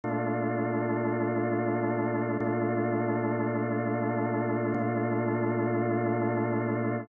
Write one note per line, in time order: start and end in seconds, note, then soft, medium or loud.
0.04 2.37 A#2 medium
0.04 2.37 A3 medium
0.04 2.37 D4 loud
0.04 2.37 F4 medium
2.40 4.74 A#2 loud
2.40 4.74 A3 loud
2.40 4.74 D4 loud
2.40 4.74 F4 medium
4.74 7.08 A#2 loud
4.74 7.08 A3 medium
4.74 7.08 D4 medium
4.74 7.08 F4 loud